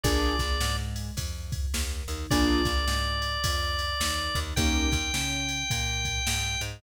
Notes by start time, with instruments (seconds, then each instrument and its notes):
0.04 electric bass (finger) A#1, acoustic grand piano A#3 D4 F4 G#4, drawbar organ D5, kick, ride
0.39 electric bass (finger) A#1, acoustic grand piano A#3, kick, snare, ride
0.60 electric bass (finger) G#2, acoustic grand piano G#3, snare
0.96 ride
1.17 electric bass (finger) F2, acoustic grand piano F3, kick, ride
1.52 kick, ride
1.74 electric bass (finger) D#2, acoustic grand piano D#3, snare
2.08 electric bass (finger) D#2, acoustic grand piano D#3, ride
2.31 electric bass (finger) A#1, acoustic grand piano A#3 D4 F4 G#4, drawbar organ D5, kick, ride
2.65 electric bass (finger) A#1, acoustic grand piano A#3, kick, snare, ride
2.88 electric bass (finger) G#2, acoustic grand piano G#3, snare
3.22 ride
3.44 electric bass (finger) F2, acoustic grand piano F3, kick, ride
3.79 ride
4.00 electric bass (finger) D#2, acoustic grand piano D#3, snare
4.35 electric bass (finger) D#2, acoustic grand piano D#3, kick, ride
4.56 electric bass (finger) D#2, acoustic grand piano A#3 C#4 D#4 G4, drawbar organ G5, kick, ride
4.92 electric bass (finger) D#2, acoustic grand piano D#3, kick, snare, ride
5.14 electric bass (finger) C#3, acoustic grand piano C#4, snare
5.48 ride
5.70 electric bass (finger) A#2, acoustic grand piano A#3, kick, ride
6.05 kick, ride
6.27 electric bass (finger) G#2, acoustic grand piano G#3, snare
6.61 electric bass (finger) G#2, acoustic grand piano G#3, ride